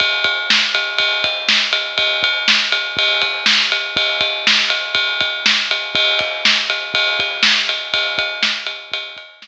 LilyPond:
\new DrumStaff \drummode { \time 4/4 \tempo 4 = 121 <bd cymr>8 <bd cymr>8 sn8 cymr8 <bd cymr>8 <bd cymr>8 sn8 cymr8 | <bd cymr>8 <bd cymr>8 sn8 cymr8 <bd cymr>8 <bd cymr>8 sn8 cymr8 | <bd cymr>8 <bd cymr>8 sn8 cymr8 <bd cymr>8 <bd cymr>8 sn8 cymr8 | <bd cymr>8 <bd cymr>8 sn8 cymr8 <bd cymr>8 <bd cymr>8 sn8 cymr8 |
<bd cymr>8 <bd cymr>8 sn8 cymr8 <bd cymr>8 <bd cymr>8 sn4 | }